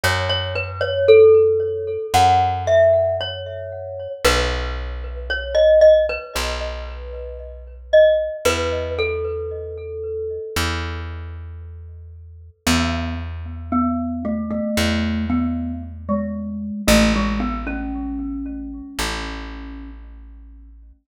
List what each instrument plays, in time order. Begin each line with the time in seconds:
0.04 electric bass (finger) F#2, glockenspiel C#5
0.29 glockenspiel C#5
0.55 glockenspiel B4
0.81 glockenspiel C#5
1.08 glockenspiel A4
2.14 electric bass (finger) F#2, glockenspiel F#5
2.67 glockenspiel E5
3.21 glockenspiel C#5
4.25 electric bass (finger) B1, glockenspiel B4
5.30 glockenspiel C#5
5.55 glockenspiel D#5
5.81 glockenspiel D#5
6.09 glockenspiel B4
6.36 electric bass (finger) B1, glockenspiel B4
7.93 glockenspiel D#5
8.45 electric bass (finger) E2, glockenspiel B4
8.99 glockenspiel A4
10.56 electric bass (finger) E2
12.66 electric bass (finger) E2, glockenspiel B3
13.72 glockenspiel B3
14.25 glockenspiel A3
14.51 glockenspiel A3
14.77 electric bass (finger) E2
15.30 glockenspiel B3
16.09 glockenspiel G#3
16.88 electric bass (finger) A1, glockenspiel A3
17.16 glockenspiel G#3
17.40 glockenspiel B3
17.67 glockenspiel C#4
18.99 electric bass (finger) A1